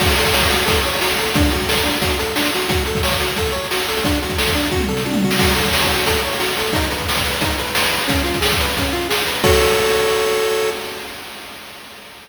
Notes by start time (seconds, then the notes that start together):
0.00 F#4, kick, crash
0.08 closed hi-hat
0.18 A4, closed hi-hat
0.25 kick, closed hi-hat
0.33 C#5, snare
0.41 kick, closed hi-hat
0.50 F#4, closed hi-hat
0.59 closed hi-hat
0.66 A4, kick, closed hi-hat
0.75 closed hi-hat
0.83 C#5, closed hi-hat
0.94 closed hi-hat
1.01 F#4, snare
1.10 closed hi-hat
1.18 A4, closed hi-hat
1.26 closed hi-hat
1.34 D4, kick, closed hi-hat
1.45 closed hi-hat
1.50 F#4, closed hi-hat
1.61 kick, closed hi-hat
1.68 A4, snare
1.76 kick, closed hi-hat
1.83 D4, closed hi-hat
1.94 closed hi-hat
2.02 F#4, kick, closed hi-hat
2.10 closed hi-hat
2.19 A4, closed hi-hat
2.27 closed hi-hat
2.36 D4, snare
2.45 closed hi-hat
2.54 F#4, closed hi-hat
2.61 closed hi-hat
2.69 F#4, kick, closed hi-hat
2.77 closed hi-hat
2.85 A4, closed hi-hat
2.95 kick, closed hi-hat
3.03 C#5, snare
3.11 kick, closed hi-hat
3.20 F#4, closed hi-hat
3.28 closed hi-hat
3.36 A4, kick, closed hi-hat
3.46 closed hi-hat
3.52 C#5, closed hi-hat
3.64 closed hi-hat
3.71 F#4, snare
3.79 closed hi-hat
3.88 A4, closed hi-hat
3.97 closed hi-hat
4.04 D4, kick, closed hi-hat
4.14 closed hi-hat
4.22 F#4, closed hi-hat
4.30 kick, closed hi-hat
4.38 A4, snare
4.46 kick, closed hi-hat
4.55 D4, closed hi-hat
4.64 closed hi-hat
4.72 F#4, kick, high tom
4.80 mid tom
4.88 A4, floor tom
4.97 snare
5.05 D4, high tom
5.13 mid tom
5.22 F#4, floor tom
5.31 snare
5.39 F#4, kick, crash
5.48 closed hi-hat
5.55 A4, closed hi-hat
5.65 kick, closed hi-hat
5.73 C#5, snare
5.82 kick, closed hi-hat
5.90 F#4, closed hi-hat
5.98 closed hi-hat
6.06 A4, kick, closed hi-hat
6.15 closed hi-hat
6.25 C#5
6.32 closed hi-hat
6.40 F#4, snare
6.49 closed hi-hat
6.57 A4, closed hi-hat
6.66 closed hi-hat
6.73 D#4, kick, closed hi-hat
6.82 closed hi-hat
6.90 B4, closed hi-hat
6.99 kick, closed hi-hat
7.08 B4, snare
7.16 kick, closed hi-hat
7.25 B4, closed hi-hat
7.33 closed hi-hat
7.41 D#4, kick, closed hi-hat
7.50 closed hi-hat
7.58 B4, closed hi-hat
7.67 closed hi-hat
7.75 B4, snare
7.83 closed hi-hat
7.91 B4, closed hi-hat
8.01 closed hi-hat
8.08 C#4, kick, closed hi-hat
8.18 closed hi-hat
8.24 F4, closed hi-hat
8.34 kick, closed hi-hat
8.41 G#4, snare
8.51 kick, closed hi-hat
8.60 B4, closed hi-hat
8.69 closed hi-hat
8.77 C#4, kick, closed hi-hat
8.85 closed hi-hat
8.93 F4, closed hi-hat
9.01 closed hi-hat
9.09 G#4, snare
9.18 closed hi-hat
9.27 B4, closed hi-hat
9.35 closed hi-hat
9.44 F#4 A4 C#5, kick, crash